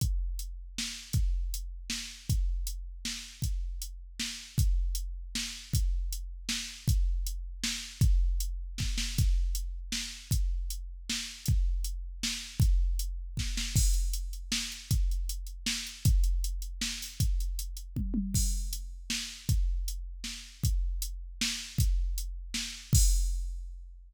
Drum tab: CC |------|------|------|------|
HH |x-x---|x-x---|x-x---|x-x---|
SD |----o-|----o-|----o-|----o-|
T1 |------|------|------|------|
BD |o-----|o-----|o-----|o-----|

CC |------|------|------|------|
HH |x-x---|x-x---|x-x---|x-x---|
SD |----o-|----o-|----o-|----oo|
T1 |------|------|------|------|
BD |o-----|o-----|o-----|o---o-|

CC |------|------|------|------|
HH |x-x---|x-x---|x-x---|x-x---|
SD |----o-|----o-|----o-|----oo|
T1 |------|------|------|------|
BD |o-----|o-----|o-----|o---o-|

CC |x-----|------|------|------|
HH |-xxx-x|xxxx-x|xxxx-o|xxxx--|
SD |----o-|----o-|----o-|------|
T1 |------|------|------|----oo|
BD |o-----|o-----|o-----|o---o-|

CC |x-----|------|------|------|
HH |--x---|x-x---|x-x---|x-x---|
SD |----o-|----o-|----o-|----o-|
T1 |------|------|------|------|
BD |o-----|o-----|o-----|o-----|

CC |x-----|
HH |------|
SD |------|
T1 |------|
BD |o-----|